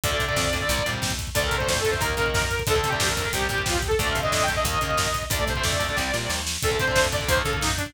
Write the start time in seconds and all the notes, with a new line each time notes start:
0.04 D2 D3 A3 D5, kick, closed hi-hat
0.11 D3 A3, kick
0.20 C3, kick, closed hi-hat
0.28 D3 A3, kick
0.36 F2, kick, snare
0.45 kick
0.53 D3 A3, kick, closed hi-hat
0.61 D3 A3, kick
0.68 C2 C3 G3, kick, closed hi-hat
0.78 kick
0.86 A#2 C3 G3, kick, closed hi-hat
0.93 kick
1.02 D#2, kick, snare
1.10 kick
1.19 kick, closed hi-hat
1.27 kick
1.35 D2 D3 A3 D5, kick, closed hi-hat
1.43 D3 A3 A#4, kick
1.51 C3, kick, closed hi-hat
1.57 D3 A3 C5, kick
1.68 F2 C5, kick, snare
1.77 A4, kick
1.85 D3 A3, kick, closed hi-hat
1.90 D3 A3 C5, kick
2.00 D#2 D#3 A#3 A#4, kick, closed hi-hat
2.10 kick
2.17 C#3 D#3 A#3, kick, closed hi-hat
2.26 kick
2.34 F#2, kick, snare
2.42 kick
2.50 kick, closed hi-hat
2.59 kick
2.67 D2 D3 A3 A4, kick, closed hi-hat
2.75 D3 A3, kick
2.84 C3, kick, closed hi-hat
2.88 G4
2.92 D3 A3, kick
3.00 F2, kick, snare
3.08 A#4, kick
3.17 D3 A3, kick, closed hi-hat
3.25 D3 A3, kick
3.33 C2 C3 G3 G4, kick, closed hi-hat
3.41 kick
3.49 A#2 C3 G3, kick, closed hi-hat
3.58 kick
3.66 D#2 F4, kick, snare
3.74 G4, kick
3.82 kick, closed hi-hat
3.88 A4, kick
3.98 D2 D3 A3 D5, kick, closed hi-hat
4.06 D3 A3, kick
4.11 F5
4.15 C3, kick, closed hi-hat
4.21 D3 A3 D#5, kick
4.32 F2 D#5, kick, snare
4.41 G5, kick
4.48 D3 A3, kick, closed hi-hat
4.56 D3 A3 D#5, kick
4.65 D#2 D#3 A#3 D#5, kick, closed hi-hat
4.73 kick
4.81 C#3 D#3 A#3, kick, closed hi-hat
4.90 kick
4.97 F#2, kick, snare
5.06 kick
5.14 kick, closed hi-hat
5.23 kick
5.30 D2 D3 A3 D5, kick, closed hi-hat
5.39 D3 A3, kick
5.47 C3 C5, kick, closed hi-hat
5.56 D3 A3, kick
5.63 F2 D5, kick, snare
5.72 kick
5.79 D3 A3, kick, closed hi-hat
5.89 D3 A3, kick
5.96 C2 C3 G3, kick, snare
6.13 A#2 C3 G3, snare
6.30 D#2, snare
6.47 snare
6.62 D2 D3 A3 A4, kick, closed hi-hat
6.71 D3 A3, kick
6.80 C3 C5, kick, closed hi-hat
6.87 D3 A3, kick
6.96 F2, kick, snare
7.05 kick
7.12 D3 A3 D5, kick, closed hi-hat
7.21 D3 A3, kick
7.28 D#2 D#3 A#3 C5, kick, closed hi-hat
7.37 A4, kick
7.45 C#3 D#3 A#3, kick, closed hi-hat
7.52 A4, kick
7.61 F#2 D#4, kick, snare
7.70 kick
7.77 D4, kick, closed hi-hat
7.86 kick